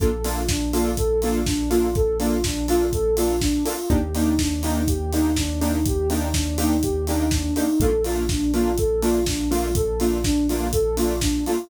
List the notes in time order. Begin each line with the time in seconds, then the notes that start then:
0.00 A#1 A#3 D4 F4 A4, kick, closed hi-hat
0.24 A#3 D4 F4 A4, open hi-hat
0.49 D4, kick, snare
0.73 A#3 D4 F4 A4, open hi-hat
0.97 A4, kick, closed hi-hat
1.22 A#3 D4 F4 A4, open hi-hat
1.46 D4, kick, snare
1.70 A#3 D4 F4 A4, open hi-hat
1.95 A4, kick, closed hi-hat
2.20 A#3 D4 F4 A4, open hi-hat
2.43 D4, kick, snare
2.68 A#3 D4 F4 A4, open hi-hat
2.92 A4, kick, closed hi-hat
3.17 A#3 D4 F4 A4, open hi-hat
3.41 D4, kick, snare
3.65 A#3 D4 F4 A4, open hi-hat
3.90 D#2 A#3 D4 D#4 G4, kick, closed hi-hat
4.15 A#3 D4 D#4 G4, open hi-hat
4.39 D4, kick, snare
4.63 A#3 D4 D#4 G4, open hi-hat
4.88 G4, kick, closed hi-hat
5.13 A#3 D4 D#4 G4, open hi-hat
5.36 D4, kick, snare
5.61 A#3 D4 D#4 G4, open hi-hat
5.86 G4, kick, closed hi-hat
6.10 A#3 D4 D#4 G4, open hi-hat
6.34 D4, kick, snare
6.58 A#3 D4 D#4 G4, open hi-hat
6.83 G4, kick, closed hi-hat
7.07 A#3 D4 D#4 G4, open hi-hat
7.31 D4, kick, snare
7.56 A#3 D4 D#4 G4, open hi-hat
7.80 A#1 A3 A#3 D4 F4 A4, kick, closed hi-hat
8.04 A3 A#3 D4 F4, open hi-hat
8.29 D4, kick, snare
8.54 A3 A#3 D4 F4, open hi-hat
8.78 A4, kick, closed hi-hat
9.02 A3 A#3 D4 F4, open hi-hat
9.26 D4, kick, snare
9.51 A3 A#3 D4 F4, open hi-hat
9.75 A4, kick, closed hi-hat
10.00 A3 A#3 D4 F4, open hi-hat
10.24 D4, kick, snare
10.48 A3 A#3 D4 F4, open hi-hat
10.73 A4, kick, closed hi-hat
10.97 A3 A#3 D4 F4, open hi-hat
11.21 D4, kick, snare
11.46 A3 A#3 D4 F4, open hi-hat